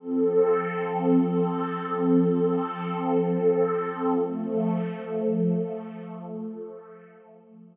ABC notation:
X:1
M:4/4
L:1/8
Q:1/4=57
K:Fmix
V:1 name="Pad 5 (bowed)"
[F,CA]8 | [F,A,A]8 |]